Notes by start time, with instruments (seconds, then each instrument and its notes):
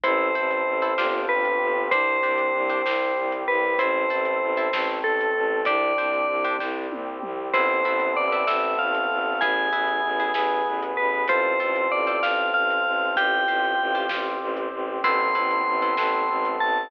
0.04 violin A1, brass section C4 E4 A4, orchestral harp E4 A4 C5, tubular bells C5, kick, closed hi-hat
0.35 violin A1, orchestral harp E4 A4 C5
0.51 closed hi-hat
0.66 violin A1
0.82 orchestral harp E4 A4 C5
0.98 violin G1, brass section C4 D4 F4 G4, orchestral harp D4 F4 G4 C5, snare
1.29 violin G1, tubular bells B4
1.45 closed hi-hat
1.61 violin G1
1.91 violin C2, brass section C4 D4 G4, orchestral harp D4 G4 C5, tubular bells C5, kick, closed hi-hat
2.23 violin C2, orchestral harp D4 G4 C5
2.38 closed hi-hat
2.54 violin C2
2.70 orchestral harp D4 G4 C5
2.85 violin C2, brass section G3 C4 G4, orchestral harp D4 G4 C5, snare
3.17 violin C2
3.32 closed hi-hat
3.48 violin C2, tubular bells B4
3.78 violin A1, brass section C4 E4 A4, orchestral harp E4 A4 C5, tubular bells C5, kick, closed hi-hat
4.10 violin A1, orchestral harp E4 A4 C5
4.25 closed hi-hat
4.42 violin A1
4.57 orchestral harp E4 A4 C5
4.73 violin A1, brass section A3 C4 A4, orchestral harp E4 A4 C5, snare
5.04 violin A1, tubular bells A4
5.21 closed hi-hat
5.36 violin A1
5.65 violin C2, brass section C4 D4 G4, orchestral harp D4 G4 C5, tubular bells D5, kick, closed hi-hat
5.98 violin C2, orchestral harp D4 G4 C5
6.13 closed hi-hat
6.29 violin C2
6.45 orchestral harp D4 G4 C5
6.59 violin C2, brass section G3 C4 G4, orchestral harp D4 G4 C5, kick, snare
6.91 violin C2, high tom
7.23 violin C2, mid tom
7.54 violin A1, brass section B3 C4 E4 A4, orchestral harp C4 E4 A4 B4, tubular bells C5, kick, crash
7.85 violin A1, orchestral harp C4 E4 A4 B4
8.00 closed hi-hat
8.17 violin A1, tubular bells D5
8.32 orchestral harp C4 E4 A4 B4
8.47 violin A1, brass section A3 B3 C4 A4, orchestral harp C4 E4 A4 B4, tubular bells E5, snare
8.79 violin A1, tubular bells F5
8.95 closed hi-hat
9.11 violin A1
9.41 violin A1, brass section B3 E4 G#4, orchestral harp E4 G#4 B4, tubular bells G#5, kick, closed hi-hat
9.73 violin A1, orchestral harp E4 G#4 B4
9.88 closed hi-hat
10.04 violin A1
10.20 orchestral harp E4 G#4 B4
10.34 violin A1, brass section B3 G#4 B4, orchestral harp E4 G#4 B4, snare
10.66 violin A1
10.83 closed hi-hat
10.97 violin A1, tubular bells B4
11.28 violin A1, brass section C4 F4 A4, orchestral harp F4 A4 C5, tubular bells C5, kick, closed hi-hat
11.60 violin A1, orchestral harp F4 A4 C5
11.76 closed hi-hat
11.91 violin A1, tubular bells D5
12.07 orchestral harp F4 A4 C5
12.23 violin A1, brass section C4 A4 C5, orchestral harp F4 A4 C5, tubular bells F5, snare
12.54 violin A1, tubular bells F5
12.70 closed hi-hat
12.86 violin A1
13.16 violin A1, brass section C4 F4 G4, orchestral harp F4 G4 C5, tubular bells G5, kick, closed hi-hat
13.48 violin A1, orchestral harp F4 G4 C5
13.64 closed hi-hat
13.79 violin A1
13.95 orchestral harp F4 G4 C5
14.09 violin A1, brass section C4 G4 C5, orchestral harp F4 G4 C5, snare
14.41 violin A1
14.57 closed hi-hat
14.72 violin A1
15.04 violin A1, brass section B3 C4 E4 A4, orchestral harp C4 E4 A4 B4, tubular bells C6, kick, crash
15.35 violin A1, orchestral harp C4 E4 A4 B4
15.51 closed hi-hat
15.67 violin A1
15.82 orchestral harp C4 E4 A4 B4
15.97 violin A1, brass section A3 B3 C4 A4, orchestral harp C4 E4 A4 B4, snare
16.29 violin A1
16.45 closed hi-hat
16.60 violin A1, tubular bells A5